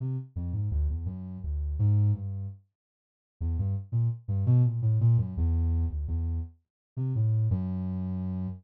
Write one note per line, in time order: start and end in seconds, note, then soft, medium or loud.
0.00 0.17 C3 medium
0.36 0.52 F2 medium
0.53 0.69 G#2 medium
0.71 0.87 D2 medium
0.89 1.05 E2 medium
1.06 1.38 F#2 medium
1.44 1.76 D2 medium
1.79 2.11 G#2 loud
2.14 2.46 G2 medium
3.41 3.57 E2 medium
3.58 3.75 G2 medium
3.92 4.08 A#2 medium
4.28 4.44 G2 medium
4.46 4.62 B2 loud
4.64 4.80 A#2 medium
4.82 4.98 A2 medium
5.01 5.17 A#2 loud
5.18 5.34 F#2 medium
5.37 5.85 E2 loud
5.90 6.06 D2 medium
6.08 6.40 E2 medium
6.97 7.13 C3 medium
7.15 7.47 A2 medium
7.51 8.47 F#2 loud